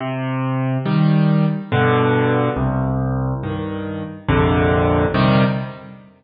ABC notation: X:1
M:3/4
L:1/8
Q:1/4=70
K:Cm
V:1 name="Acoustic Grand Piano" clef=bass
C,2 [E,G,]2 [G,,=B,,D,]2 | C,,2 [G,,E,]2 [B,,,F,,C,D,]2 | [C,E,G,]2 z4 |]